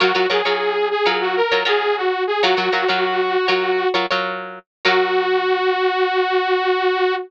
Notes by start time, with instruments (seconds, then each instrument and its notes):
0.00 acoustic guitar (steel) F#3 F4 A#4 C#5, lead 2 (sawtooth) F#4
0.15 acoustic guitar (steel) F#3 F4 A#4 C#5
0.30 acoustic guitar (steel) F#3 F4 A#4 C#5, lead 2 (sawtooth) G#4
0.45 acoustic guitar (steel) F#3 F4 A#4 C#5
0.91 lead 2 (sawtooth) G#4
1.06 acoustic guitar (steel) F#3 F4 A#4 C#5
1.21 lead 2 (sawtooth) F#4
1.36 lead 2 (sawtooth) A#4
1.52 acoustic guitar (steel) F#3 F4 A#4 C#5
1.65 acoustic guitar (steel) F#3 F4 A#4 C#5, lead 2 (sawtooth) G#4
1.97 lead 2 (sawtooth) F#4
2.27 lead 2 (sawtooth) G#4
2.42 acoustic guitar (steel) F#3 F4 A#4 C#5, lead 2 (sawtooth) F#4
2.57 acoustic guitar (steel) F#3 F4 A#4 C#5
2.72 acoustic guitar (steel) F#3 F4 A#4 C#5
2.88 acoustic guitar (steel) F#3 F4 A#4 C#5
3.48 acoustic guitar (steel) F#3 F4 A#4 C#5
3.94 acoustic guitar (steel) F#3 F4 A#4 C#5
4.10 acoustic guitar (steel) F#3 F4 A#4 C#5
4.85 acoustic guitar (steel) F#3 F4 A#4 C#5, lead 2 (sawtooth) F#4